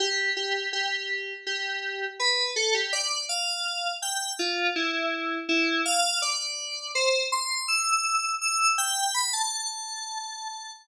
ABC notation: X:1
M:4/4
L:1/16
Q:1/4=82
K:Gmix
V:1 name="Electric Piano 2"
G2 G2 G4 G4 B2 A G | d2 f4 g2 F2 E4 E2 | f2 d4 c2 c'2 e'4 e'2 | g2 b a9 z4 |]